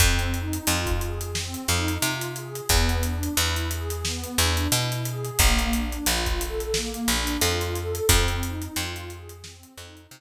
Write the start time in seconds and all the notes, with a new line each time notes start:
0.00 F2 C4, kick, closed hi-hat
0.19 closed hi-hat
0.34 D#4, closed hi-hat
0.53 closed hi-hat
0.67 F2 F4, closed hi-hat
0.86 kick, closed hi-hat
1.01 G#4, closed hi-hat
1.21 closed hi-hat
1.35 C4, snare
1.54 closed hi-hat
1.68 F2 D#4, closed hi-hat
1.88 closed hi-hat
2.02 C3 F4, closed hi-hat
2.21 closed hi-hat
2.36 G#4, closed hi-hat
2.55 closed hi-hat
2.69 E2 B3, kick, closed hi-hat
2.89 closed hi-hat
3.03 D4, closed hi-hat
3.23 closed hi-hat
3.37 E2 E4, closed hi-hat
3.56 closed hi-hat
3.71 G#4, closed hi-hat
3.90 closed hi-hat
4.04 B3, snare
4.24 closed hi-hat
4.38 E2 D4, closed hi-hat
4.57 closed hi-hat
4.72 B2 E4, closed hi-hat
4.92 closed hi-hat
5.05 G#4, closed hi-hat
5.25 closed hi-hat
5.39 A#1 A#3, kick, closed hi-hat
5.59 closed hi-hat
5.73 D4, closed hi-hat
5.92 closed hi-hat
6.06 A#1 F4, closed hi-hat
6.26 kick, closed hi-hat
6.40 A4, closed hi-hat
6.60 closed hi-hat
6.74 A#3, snare
6.94 closed hi-hat
7.08 A#1 D4, closed hi-hat
7.27 closed hi-hat
7.41 F2 F4, closed hi-hat
7.61 closed hi-hat
7.75 A4, closed hi-hat
7.95 closed hi-hat
8.09 F2 C4, kick, closed hi-hat
8.28 closed hi-hat
8.43 D#4, closed hi-hat
8.62 closed hi-hat
8.76 F2 F4, closed hi-hat
8.96 closed hi-hat
9.10 G#4, closed hi-hat
9.29 closed hi-hat
9.44 C4, snare
9.63 closed hi-hat
9.77 F2 D#4, closed hi-hat
9.97 closed hi-hat
10.11 C3 F4, closed hi-hat